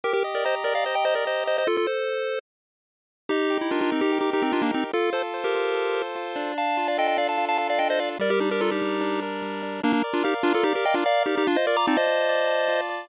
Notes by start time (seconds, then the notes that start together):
0.04 G4 A#4
0.13 G4 A#4
0.24 D#5
0.35 A#4 D5
0.45 C5 D#5 A#5
0.64 G4 A#4 D5
0.75 D5 F5
0.84 C5 D#5
0.95 D#5 G5
1.05 C5 D#5 A#5
1.15 A#4 D5
1.25 G4 C5 D#5
1.46 C5 D#5
1.58 C5 D#5
1.67 F4 A4
1.77 F4 A4
1.87 A4 C5
3.29 D#4 G4
3.50 G4
3.61 E4
3.71 D4 F4 A#4
3.81 D4 F4
3.91 C4 D#4
4.01 D#4 G4
4.12 G4
4.21 D#4 G4
4.33 D#4 G4 A#4
4.42 C4 D#4
4.52 D4 D#4 F4
4.62 A#3 D4
4.72 C4 D#4 G4
4.93 F4 A4
5.13 A4 C5
5.34 C5
5.44 G4 A#4
5.55 F4
5.74 A4
5.94 C5
6.15 F4
6.36 D4
6.58 F5 A5
6.77 F4
6.88 D5 F5
6.98 A4 D#5 G5
7.08 D#5 G5
7.18 D4 D5 F5
7.29 F5 A5
7.38 F4
7.49 F5 A5
7.58 A4 F5 A5
7.70 D5 F5
7.79 D4 D#5 G5
7.90 C5 D#5
7.99 F4 D5 F5
8.19 G3 A#4 D5
8.30 G4 A#4
8.40 D4 D#4 G4
8.51 G4 A#4
8.60 F4 A4 A#4
8.72 D#4 G4
8.82 G3
9.01 D4
9.22 A#4
9.42 G3
9.62 D4
9.83 A#3 D4 A#4
9.93 A#3 D4
10.04 D5
10.13 D4 F4
10.24 D#4 G4 F5
10.43 D4 F4 A#4
10.54 F4 A4
10.63 D#4 G4 D5
10.75 G4 A#4
10.85 D#5 F5 G5
10.94 D4 F4
11.06 A#4 D5 F5
11.26 D#4 G4 D5
11.37 D#4 G4
11.47 D4 F4
11.56 C5 D#5
11.67 A#4 D5
11.77 A#5 D6
11.87 C4 D#4 A5
11.97 C5 D#5
12.07 F4
12.29 D5
12.47 A5
12.68 F4
12.89 D5